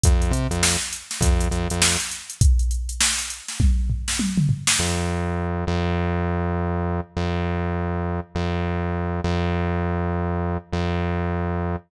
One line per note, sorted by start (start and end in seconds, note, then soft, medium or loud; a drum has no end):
0.03 0.32 F2 loud
0.03 kick medium
0.03 closed hi-hat loud
0.22 closed hi-hat medium
0.31 0.47 C3 medium
0.31 closed hi-hat medium
0.50 0.77 F2 medium
0.50 closed hi-hat medium
0.63 snare loud
0.81 closed hi-hat medium
0.93 closed hi-hat medium
1.11 snare medium
1.11 closed hi-hat medium
1.21 1.48 F2 loud
1.21 kick medium
1.21 closed hi-hat medium
1.40 closed hi-hat medium
1.51 1.68 F2 medium
1.51 closed hi-hat medium
1.70 1.97 F2 medium
1.70 closed hi-hat medium
1.82 snare loud
2.00 closed hi-hat medium
2.11 snare soft
2.11 closed hi-hat medium
2.30 closed hi-hat medium
2.41 kick loud
2.41 closed hi-hat medium
2.59 closed hi-hat medium
2.71 closed hi-hat medium
2.89 closed hi-hat medium
3.00 snare loud
3.19 closed hi-hat medium
3.30 closed hi-hat medium
3.48 snare medium
3.48 closed hi-hat medium
3.60 kick medium
3.60 high tom medium
3.90 floor tom medium
4.08 snare medium
4.19 high tom medium
4.37 mid tom medium
4.49 floor tom medium
4.67 snare loud
4.79 5.65 F2 medium
5.67 7.00 F2 loud
7.17 8.20 F2 medium
8.35 9.21 F2 medium
9.24 10.58 F2 loud
10.73 11.76 F2 loud